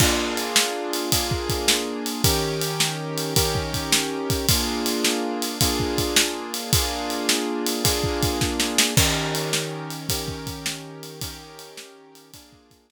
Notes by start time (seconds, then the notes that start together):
0.00 A#3 D4 F4 G#4, kick, crash
0.37 ride
0.56 snare
0.93 ride
1.12 A#3 D4 F4 G#4, kick, ride
1.31 kick
1.49 kick, ride
1.68 snare
2.06 ride
2.24 D#3 C#4 G4 A#4, kick, ride
2.61 ride
2.80 snare
3.18 ride
3.36 D#3 C#4 G4 A#4, kick, ride
3.55 kick
3.74 kick, ride
3.92 snare
4.30 kick, ride
4.49 A#3 D4 F4 G#4, kick, ride
4.86 ride
5.04 snare
5.42 ride
5.61 A#3 D4 F4 G#4, kick, ride
5.80 kick
5.98 kick, ride
6.16 snare
6.54 ride
6.73 A#3 D4 F4 G#4, kick, ride
7.10 ride
7.29 snare
7.66 ride
7.84 A#3 D4 F4 G#4, kick, ride
8.04 kick
8.23 kick, ride
8.41 kick, snare
8.60 snare
8.78 snare
8.97 D#3 C#4 G4 A#4, kick, crash
9.35 ride
9.53 snare
9.90 ride
10.09 D#3 C#4 G4 A#4, kick, ride
10.28 kick
10.47 kick, ride
10.66 snare
11.03 ride
11.21 D#3 C#4 G4 A#4, kick, ride
11.59 ride
11.77 snare
12.15 ride
12.34 A#3 D4 F4 G#4, kick, ride
12.53 kick
12.71 kick, ride
12.90 snare